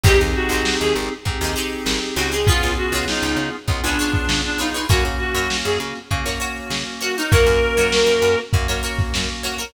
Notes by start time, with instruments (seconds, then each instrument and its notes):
0.03 electric bass (finger) G#1, electric piano 2 C4 D#4 G4 G#4, pizzicato strings D#4 G4 G#4 C5, clarinet G4, kick, crash
0.20 electric bass (finger) D#2, closed hi-hat
0.35 clarinet F#4, closed hi-hat
0.49 electric bass (finger) G#1, pizzicato strings G4 G#4 C5, closed hi-hat
0.53 pizzicato strings D#4
0.65 snare
0.80 electric bass (finger) D#2, clarinet G#4, closed hi-hat
0.95 electric bass (finger) G#1, closed hi-hat
1.11 closed hi-hat
1.25 electric bass (finger) G#2, electric piano 2 C4 D#4 G4 G#4, kick, closed hi-hat
1.41 electric bass (finger) D#2, pizzicato strings D#4 G4 G#4 C5, closed hi-hat
1.56 pizzicato strings D#4 G4 G#4 C5, closed hi-hat
1.71 closed hi-hat
1.86 electric bass (finger) G#1, snare
2.01 closed hi-hat
2.15 electric bass (finger) C#2, pizzicato strings D#4 G4 G#4 C5, clarinet F#4, snare, closed hi-hat
2.32 pizzicato strings D#4 G4 G#4 C5, clarinet G#4, closed hi-hat
2.47 electric piano 2 B3 C#4 F4 G#4, clarinet F4, pizzicato strings F4 G#4 B4 C#5, kick, closed hi-hat
2.62 electric bass (finger) C#2, closed hi-hat
2.77 clarinet F#4, closed hi-hat
2.92 electric bass (finger) C#2, pizzicato strings F4 G#4 B4 C#5, closed hi-hat
3.08 clarinet D#4, snare
3.22 electric bass (finger) C#2, closed hi-hat
3.36 electric bass (finger) C#3, closed hi-hat
3.53 closed hi-hat
3.68 electric bass (finger) C#2, electric piano 2 B3 C#4 F4 G#4, kick, closed hi-hat
3.83 electric bass (finger) C#2, clarinet D4, pizzicato strings F4 G#4 B4 C#5, snare, closed hi-hat
3.99 pizzicato strings F4 G#4 B4 C#5, closed hi-hat
4.14 kick, closed hi-hat
4.29 electric bass (finger) C#3, snare
4.44 clarinet D4, snare, closed hi-hat
4.58 clarinet D#4, pizzicato strings F4 G#4 B4 C#5, snare, closed hi-hat
4.74 pizzicato strings F4 G#4 B4 C#5, closed hi-hat
4.89 electric bass (finger) F#2, electric piano 2 A#3 C#4 F#4, clarinet F#4, pizzicato strings F#4 A#4 C#5, kick, closed hi-hat
5.04 electric bass (finger) C#3, closed hi-hat
5.19 clarinet F#4, closed hi-hat
5.34 electric bass (finger) F#2, pizzicato strings F#4 A#4 C#5, closed hi-hat
5.50 snare
5.64 electric bass (finger) F#2, clarinet G#4, closed hi-hat
5.80 electric bass (finger) C#3, closed hi-hat
5.95 closed hi-hat
6.11 electric bass (finger) C#3, electric piano 2 A#3 C#4 F#4, kick, closed hi-hat
6.26 electric bass (finger) F#2, pizzicato strings F#4 A#4 C#5, closed hi-hat
6.40 pizzicato strings F#4 A#4 C#5, closed hi-hat
6.56 closed hi-hat
6.70 electric bass (finger) C#3, snare
6.86 closed hi-hat
7.01 pizzicato strings F#4 A#4 C#5, clarinet F#4, snare, closed hi-hat
7.16 clarinet D#4, pizzicato strings F#4 A#4 C#5, closed hi-hat
7.31 electric bass (finger) F#2, electric piano 2 A#3 C#4 F#4, pizzicato strings F#4 A#4 C#5, clarinet A#4, kick, closed hi-hat
7.46 electric bass (finger) F#2, closed hi-hat
7.62 closed hi-hat
7.77 electric bass (finger) F#2, pizzicato strings F#4 A#4 C#5, snare, closed hi-hat
7.92 snare
8.06 electric bass (finger) F#2, closed hi-hat
8.22 electric bass (finger) F#2, closed hi-hat
8.38 snare, closed hi-hat
8.53 electric bass (finger) F#2, electric piano 2 A#3 C#4 F#4, kick, closed hi-hat
8.68 electric bass (finger) F#2, pizzicato strings F#4 A#4 C#5, closed hi-hat
8.83 pizzicato strings F#4 A#4 C#5, closed hi-hat
8.98 kick, snare, closed hi-hat
9.14 electric bass (finger) F#2, snare
9.29 closed hi-hat
9.43 pizzicato strings F#4 A#4 C#5, snare, closed hi-hat
9.58 pizzicato strings F#4 A#4 C#5, snare, closed hi-hat